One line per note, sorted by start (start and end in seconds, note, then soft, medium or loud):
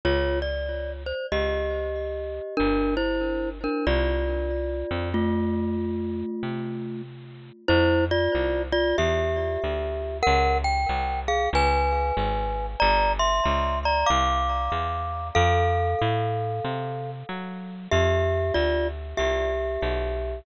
0.05 1.13 C#2 medium
0.05 0.39 F4 medium
0.05 0.39 C#5 medium
0.42 0.92 D5 medium
1.06 1.26 C5 medium
1.32 2.40 C#2 medium
1.32 2.55 G4 medium
1.32 2.55 D#5 medium
2.57 3.68 G1 medium
2.57 2.95 D4 medium
2.57 2.95 A#4 loud
2.97 3.49 E4 medium
2.97 3.49 C5 medium
3.64 3.85 D4 medium
3.64 3.85 A#4 medium
3.87 4.84 C2 medium
3.87 5.09 F4 medium
3.87 5.09 D5 medium
4.91 6.23 F2 medium
5.14 7.02 A3 medium
5.14 7.02 F4 medium
6.43 7.51 C3 medium
7.68 8.28 F2 medium
7.68 8.05 E4 loud
7.68 8.05 C5 loud
8.11 8.62 F4 medium
8.11 8.62 D5 loud
8.35 8.94 C2 medium
8.72 8.96 F4 loud
8.72 8.96 D5 loud
8.98 9.57 E2 medium
8.98 10.18 G4 medium
8.98 10.18 E5 medium
9.64 10.22 D2 medium
10.23 10.58 A#4 loud
10.23 10.58 F#5 loud
10.27 10.86 C#2 loud
10.64 11.20 G5 loud
10.89 11.48 C2 medium
11.28 11.49 G#4 medium
11.28 11.49 F5 loud
11.53 12.12 C#2 loud
11.53 12.66 B4 medium
11.53 12.66 G#5 loud
12.17 12.76 G#1 medium
12.80 13.41 G1 loud
12.80 13.12 D5 loud
12.80 13.12 A#5 loud
13.19 13.79 E5 medium
13.19 13.79 C6 medium
13.45 14.04 C#2 medium
13.85 14.09 D5 medium
13.85 14.09 A#5 medium
14.06 14.69 C2 medium
14.06 15.28 F5 medium
14.06 15.28 D6 medium
14.72 15.31 E2 medium
15.35 15.95 F2 loud
15.35 17.11 A4 loud
15.35 17.11 F5 loud
16.01 16.60 A2 medium
16.64 17.23 C3 medium
17.29 17.88 F#3 medium
17.91 18.51 F2 medium
17.91 18.53 G4 medium
17.91 18.53 E5 loud
18.54 19.14 D2 medium
18.54 18.88 F4 medium
18.54 18.88 D5 loud
19.17 19.78 C2 medium
19.17 20.39 G4 medium
19.17 20.39 E5 medium
19.82 20.41 B1 medium